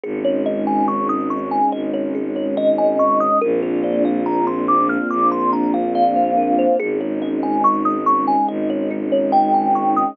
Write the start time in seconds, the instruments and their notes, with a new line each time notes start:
0.04 violin G#1, string ensemble 1 G#3 C#4 D#4, kalimba G#4
0.24 kalimba C#5
0.46 kalimba D#5
0.67 kalimba G#5
0.88 kalimba C#6
1.09 kalimba D#6
1.30 kalimba C#6
1.51 kalimba G#5
1.72 violin G#1, kalimba D#5
1.94 kalimba C#5
2.15 kalimba G#4
2.36 kalimba C#5
2.57 kalimba D#5
2.78 kalimba G#5
2.99 kalimba C#6
3.20 kalimba D#6
3.41 violin A#1, string ensemble 1 A#3 C4 D4 F4, kalimba A#4
3.63 kalimba C5
3.84 kalimba D5
4.05 kalimba F5
4.26 kalimba A#5
4.47 kalimba C6
4.68 kalimba D6
4.89 kalimba F6
5.10 violin A#1, kalimba D6
5.32 kalimba C6
5.53 kalimba A#5
5.74 kalimba F5
5.95 kalimba D5 F5
6.16 kalimba C5
6.37 kalimba A#4
6.58 kalimba C5
6.78 violin G#1, string ensemble 1 G#3 C#4 D#4, kalimba G#4
7.01 kalimba C#5
7.22 kalimba D#5
7.43 kalimba G#5
7.64 kalimba C#6
7.85 kalimba D#6
8.06 kalimba C#6
8.27 kalimba G#5
8.48 violin G#1, kalimba D#5
8.70 kalimba C#5
8.91 kalimba G#4
9.12 kalimba C#5
9.32 kalimba D#5 G5
9.54 kalimba G#5
9.75 kalimba C#6
9.96 kalimba D#6